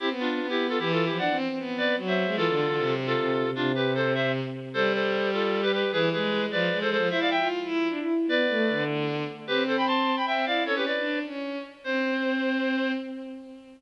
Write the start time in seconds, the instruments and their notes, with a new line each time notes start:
0.00 violin C4, clarinet E4 G4
0.10 violin B3
0.20 clarinet D4 F4
0.30 violin B3
0.40 violin B3
0.49 clarinet E4 G4
0.69 clarinet F4 A4
0.79 violin E3, clarinet E4 G4
0.92 clarinet F4 A4
1.05 clarinet E4 G4
1.10 violin F3
1.18 violin D4, clarinet D5 F#5
1.30 violin C4
1.49 violin C4
1.58 violin B3
1.78 clarinet B4 D5
1.97 violin F#3
2.07 clarinet C5 E5
2.26 violin G#3
2.36 violin E3, clarinet F4 A4
2.48 violin D3
2.68 violin D3
2.77 violin C3
3.06 clarinet F4 A4
3.17 violin C3
3.44 violin C3
3.54 violin C3, clarinet D4 F4
3.75 clarinet G4 B4
3.95 clarinet A4 C5
4.14 clarinet C5 E5
4.74 violin G3, clarinet A4 C5
4.93 clarinet A4 C5
5.33 clarinet F4 A4
5.63 clarinet G4 B4
5.72 clarinet G4 B4
5.92 violin E3, clarinet G#4 B4
6.12 violin G#3, clarinet G#4 B4
6.51 violin F3, clarinet B4 D5
6.70 violin G#3
6.81 violin G#3, clarinet A4 C5
6.91 clarinet A4 C5
6.96 violin F3
7.09 violin E4, clarinet C5 E5
7.20 clarinet D5 F5
7.30 clarinet E5 G5
7.38 violin F4
7.64 violin E4
7.89 violin D4
8.00 violin E4
8.27 violin B3, clarinet B4 D5
8.49 violin A3
8.69 violin D3
9.47 violin C4, clarinet G4 B4
9.67 clarinet A4 C5
9.77 clarinet G5 B5
9.87 clarinet A5 C6
10.17 clarinet G5 B5
10.26 violin C4, clarinet E5 G5
10.46 violin E4, clarinet D5 F5
10.65 violin C#4, clarinet A4 C#5
10.76 clarinet G4 B4
10.86 clarinet B4 D5
10.97 violin D4
11.25 violin C#4
11.84 violin C4, clarinet C5